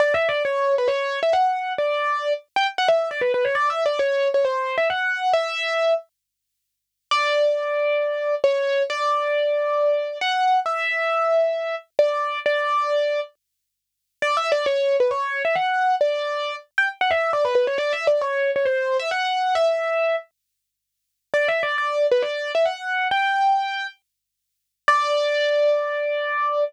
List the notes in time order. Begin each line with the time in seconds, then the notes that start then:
0.00 D5
0.14 E5
0.29 D5
0.45 C#5
0.78 B4
0.88 C#5
1.23 E5
1.33 F#5
1.78 D5
2.56 G5
2.78 F#5
2.88 E5
3.11 D5
3.21 B4
3.34 B4
3.45 C#5
3.55 D5
3.70 E5
3.86 D5
3.99 C#5
4.34 C#5
4.45 C5
4.78 E5
4.90 F#5
5.33 E5
7.11 D5
8.44 C#5
8.90 D5
10.21 F#5
10.66 E5
11.99 D5
12.46 D5
14.22 D5
14.37 E5
14.52 D5
14.66 C#5
15.00 B4
15.11 C#5
15.45 E5
15.55 F#5
16.01 D5
16.78 G5
17.01 F#5
17.11 E5
17.33 D5
17.45 B4
17.55 B4
17.67 C#5
17.78 D5
17.93 E5
18.07 D5
18.21 C#5
18.56 C#5
18.65 C5
18.99 E5
19.11 F#5
19.55 E5
21.34 D5
21.48 E5
21.63 D5
21.78 D5
22.11 B4
22.22 D5
22.55 E5
22.65 F#5
23.11 G5
24.88 D5